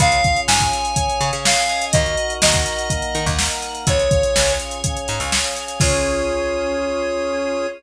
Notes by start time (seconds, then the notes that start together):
0.00 C#2 C#4 F4 G#4 C#5 F5, kick, closed hi-hat
0.12 closed hi-hat
0.24 F5, kick, closed hi-hat
0.36 closed hi-hat
0.48 G#2 G#5, snare
0.60 kick, closed hi-hat
0.72 F5, closed hi-hat
0.85 closed hi-hat
0.96 C#4 G#4 C#5, kick, closed hi-hat
1.10 closed hi-hat
1.21 C#3 F5, closed hi-hat
1.33 C#3, closed hi-hat
1.45 F5 G#5, snare
1.57 closed hi-hat
1.69 D#5, closed hi-hat
1.82 closed hi-hat
1.93 D#2 D#4 F#4 A#4 D#5, kick, closed hi-hat
2.06 closed hi-hat
2.17 F#5, closed hi-hat
2.30 closed hi-hat
2.42 D#2 D#5 A#5, snare
2.54 kick, closed hi-hat
2.66 F#5, closed hi-hat
2.79 closed hi-hat
2.90 A#3 D#4 A#4 D#5, kick, closed hi-hat
3.02 closed hi-hat
3.14 D#3 F#5, closed hi-hat
3.26 D#2, kick, closed hi-hat
3.39 A#5, snare
3.51 closed hi-hat
3.62 F#5, closed hi-hat
3.75 closed hi-hat
3.87 C#2 C#4 F4 G#4 C#5, kick, closed hi-hat
3.99 closed hi-hat
4.11 F5, kick, closed hi-hat
4.23 closed hi-hat
4.35 C#2 G#5, snare
4.47 closed hi-hat
4.59 F5, closed hi-hat
4.71 closed hi-hat
4.83 C#4 G#4 C#5, kick, closed hi-hat
4.97 closed hi-hat
5.08 G#2 F5, closed hi-hat
5.20 C#2, closed hi-hat
5.32 G#5, snare
5.44 closed hi-hat
5.56 F5, closed hi-hat
5.68 closed hi-hat
5.80 C#2 C#4 F4 G#4 C#5, kick, crash